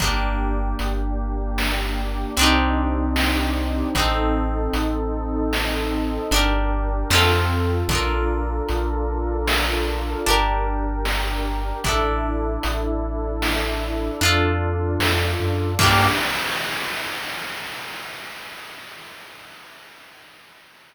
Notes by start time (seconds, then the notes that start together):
0.00 G1 A#3 D4 G4, kick, closed hi-hat
0.79 G1, closed hi-hat
1.58 snare
2.37 C2 C4 D4 D#4 G4, closed hi-hat
2.41 D#4 G4
3.16 snare
3.95 A1 C4 D#4 A4, kick, closed hi-hat
4.00 A4
4.73 A1, closed hi-hat
5.53 snare
6.31 G1 D4 G4 A#4, closed hi-hat
6.36 A#4
7.10 F2 C4 F4 A4, snare
7.15 A4
7.88 A#1 D4 F4 A4 A#4, kick, closed hi-hat
7.93 A4 A#4
8.69 A#1, closed hi-hat
9.48 snare
10.26 G1 D4 G4 A#4, closed hi-hat
10.30 A#4
11.05 snare
11.84 A1 D4 E4 A4, kick, closed hi-hat
11.88 A4
12.63 A1, closed hi-hat
13.42 snare
14.21 F2 D4 F4 A4, closed hi-hat
14.25 A4
15.00 F2, snare
15.40 F#2
15.79 G2 A#3 D4 G4, kick, crash
15.83 G4